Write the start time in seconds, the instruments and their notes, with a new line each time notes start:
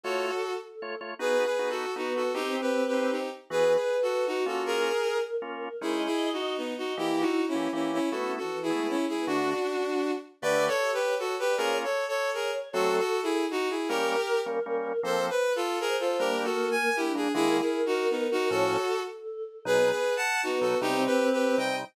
0.04 drawbar organ A3 F4 C#5, violin F#4 A4, choir aahs C#5
0.61 choir aahs A4
0.82 drawbar organ A3 F4 C#5
1.01 drawbar organ A3 F4 C#5
1.19 choir aahs B3, drawbar organ B3 D#4 F#4, violin G#4 B4
1.45 violin G#4 B4
1.59 drawbar organ B3 D#4 F#4
1.70 violin F#4 A4
1.96 drawbar organ B3 D#4 F#4, choir aahs B3, violin D#4 F#4
2.16 violin F#4 A4
2.34 drawbar organ C4 D#4 G4, choir aahs C4, violin D#4 G4
2.61 violin G4 B4
2.87 violin G4 B4
2.93 drawbar organ C4 D#4 G4
3.11 violin D#4 G4
3.50 drawbar organ E3 B3 F#4, violin G#4 B4, choir aahs B4
3.75 violin G#4 B4
4.02 violin F#4 A4
4.27 violin D#4 F#4, choir aahs F#4
4.46 drawbar organ A#3 C#4 F4, violin F#4 A4
4.66 violin G#4 A#4, choir aahs A#4
5.42 drawbar organ A#3 C#4 F4, choir aahs A#4
5.81 drawbar organ G#3 C#4 D#4, violin E4 G#4, choir aahs D#5
6.06 violin E4 G#4
6.33 violin D#4 F#4
6.57 violin B3 D#4, choir aahs D#5
6.68 choir aahs D#5
6.78 violin D#4 F#4
6.97 drawbar organ E3 A#3 G4, choir aahs E4, violin E4 G4
7.20 violin D#4 F#4
7.48 violin C#4 E4
7.55 drawbar organ E3 A#3 G4
7.73 drawbar organ E3 A#3 G4, violin C#4 E4
7.93 violin C#4 E4
8.11 drawbar organ A3 B3 E4, choir aahs B3, violin F#4 A4
8.23 choir aahs C#4
8.32 choir aahs C#4
8.38 choir aahs E3, violin F#4 A4
8.50 choir aahs E3
8.62 violin E4 G#4
8.70 choir aahs G#3, drawbar organ A3 B3 E4
8.89 violin C#4 E4
9.06 choir aahs G#3, violin E4 G#4
9.18 choir aahs B3
9.27 drawbar organ D3 A3 F#4, violin D4 F#4, choir aahs D4
10.41 drawbar organ D3 A3 G4, choir aahs D4, violin B4 D5
10.51 choir aahs E5
10.63 choir aahs E5
10.68 violin A4 C#5
10.72 choir aahs A4
10.81 choir aahs G4
10.93 violin G4 B4
11.01 choir aahs C#5
11.19 violin F#4 A4
11.39 violin G4 B4, choir aahs B4
11.49 choir aahs D5
11.57 drawbar organ A#3 C#4 F4, violin G#4 A#4, choir aahs C#5
11.84 violin A4 C#5
12.08 violin A4 C#5
12.34 violin G#4 A#4, choir aahs C#5
12.73 drawbar organ F#3 A3 C4, violin F#4 A4, choir aahs A4
12.98 violin F#4 A4
13.23 violin E4 G#4
13.51 violin D#4 F#4
13.70 violin E4 G#4
13.88 drawbar organ G3 A#3 C#4, violin G4 A#4, choir aahs A#4
14.46 drawbar organ G3 A#3 C#4
14.66 drawbar organ G3 A#3 C#4
15.03 drawbar organ F3 A#3 C4, violin A4 C5, choir aahs C5
15.30 violin B4
15.56 violin F4 A4
15.80 violin G#4 A#4, choir aahs C5
16.00 violin F4 A4
16.19 drawbar organ G3 A#3 D4, choir aahs A#3, violin G4 A#4
16.44 violin F#4 A4
16.71 violin G#5
16.96 choir aahs D4, violin E4 G4
17.15 drawbar organ G3 A#3 D4, violin G#4
17.34 drawbar organ D#3 G#3 A#3, violin E4 G#4, choir aahs A#4
17.60 violin E4 G#4
17.86 violin D#4 F#4
18.10 violin B3 D#4
18.31 violin D#4 F#4
18.50 drawbar organ A2 F3 C#4, violin F#4 A4, choir aahs C#5
19.08 choir aahs A4
19.65 drawbar organ B2 F#3 D#4, choir aahs B3, violin G#4 B4
19.90 violin G#4 B4
20.17 violin F#5 A5
20.42 choir aahs B3, violin D#4 F#4
20.61 drawbar organ B2 F#3 D#4, violin F#4 A4
20.81 drawbar organ C3 G3 D#4, choir aahs C4, violin D#4 G4
21.06 violin G4 B4
21.32 violin G4 B4
21.58 drawbar organ C3 G3 D#4, violin D#5 G5